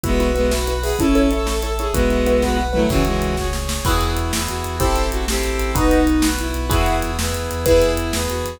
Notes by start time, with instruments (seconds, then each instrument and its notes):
0.04 synth bass 2 B1, violin G#3 B3 F#4, acoustic grand piano E4 F#4 B4, brass section B4 E5 F#5, kick, closed hi-hat
0.20 acoustic grand piano E4 F#4 B4, closed hi-hat
0.35 violin G#3 B3, acoustic grand piano E4 F#4 B4, closed hi-hat
0.51 acoustic grand piano E4 F#4 B4, brass section B4 F#5 B5, snare
0.67 acoustic grand piano E4 F#4 B4, closed hi-hat
0.82 acoustic grand piano E4 F#4 B4, violin G#4, open hi-hat
0.99 synth bass 2 A1, violin C#4 E4 A4, acoustic grand piano E4 A4 C#5, brass section A4 C#5 E5, kick, closed hi-hat
1.15 acoustic grand piano E4 A4 C#5, closed hi-hat
1.31 acoustic grand piano E4 A4 C#5, closed hi-hat
1.46 acoustic grand piano E4 A4 C#5, brass section A4 E5 A5, snare
1.62 acoustic grand piano E4 A4 C#5, closed hi-hat
1.79 acoustic grand piano E4 A4 C#5, violin G#4, closed hi-hat
1.93 synth bass 2 B1, violin G#3 B3 F#4, acoustic grand piano E4 F#4 B4, brass section B4 E5 F#5, kick, closed hi-hat
2.10 acoustic grand piano E4 F#4 B4, closed hi-hat
2.26 acoustic grand piano E4 F#4 B4, closed hi-hat
2.42 acoustic grand piano E4 F#4 B4, brass section B4 F#5 B5, kick, snare
2.57 acoustic grand piano E4 F#4 B4
2.73 violin F#3 A3 E4, acoustic grand piano E4 F#4 B4, mid tom
2.89 synth bass 2 C#2, violin C#3 E3 F#4, brass section C#5 E5 G#5, kick, crash
3.05 violin E3 G#3, closed hi-hat
3.22 closed hi-hat
3.37 brass section G#4 C#5 G#5, kick, snare
3.53 snare
3.69 snare
3.85 synth bass 2 E2, brass section B3 E4 F#4 G#4, violin E4, acoustic grand piano E4 F#4 G#4 B4, kick, crash
4.01 synth bass 2 E2, closed hi-hat
4.17 synth bass 2 E2, closed hi-hat
4.33 synth bass 2 E2, brass section B3 E4 G#4 B4, snare
4.48 synth bass 2 E2, violin F#4, closed hi-hat
4.64 synth bass 2 E2, closed hi-hat
4.79 synth bass 2 A1, brass section C4 E4 G4 A4, violin E4, acoustic grand piano E4 G4 A4 C5, kick, closed hi-hat
4.95 synth bass 2 A1, closed hi-hat
5.11 synth bass 2 A1, violin F#4, closed hi-hat
5.28 synth bass 2 A1, brass section C4 E4 A4 C5, violin G4, snare
5.43 synth bass 2 A1, closed hi-hat
5.59 synth bass 2 A1, closed hi-hat
5.75 synth bass 2 B1, brass section B3 D#4 F#4, acoustic grand piano D#4 F#4 B4, violin D#4, kick, closed hi-hat
5.91 synth bass 2 B1, closed hi-hat
6.07 synth bass 2 B1, closed hi-hat
6.22 synth bass 2 B1, brass section B3 F#4 B4, snare
6.39 synth bass 2 B1, violin E4, closed hi-hat
6.54 synth bass 2 B1, closed hi-hat
6.70 synth bass 2 E2, brass section B3 E4 F#4 G#4, acoustic grand piano E4 F#4 G#4 B4, violin E4, kick, closed hi-hat
6.86 synth bass 2 E2, closed hi-hat
7.02 synth bass 2 E2, closed hi-hat
7.18 synth bass 2 E2, brass section B3 E4 G#4 B4, snare
7.33 synth bass 2 E2, closed hi-hat
7.51 synth bass 2 E2, closed hi-hat
7.66 synth bass 2 E2, brass section B3 E4 G#4, acoustic grand piano E4 G#4 B4, violin E4, kick, closed hi-hat
7.82 synth bass 2 E2, closed hi-hat
7.97 synth bass 2 E2, closed hi-hat
8.12 synth bass 2 E2, brass section B3 G#4 B4, snare
8.28 synth bass 2 E2, violin F#4, closed hi-hat
8.45 synth bass 2 E2, closed hi-hat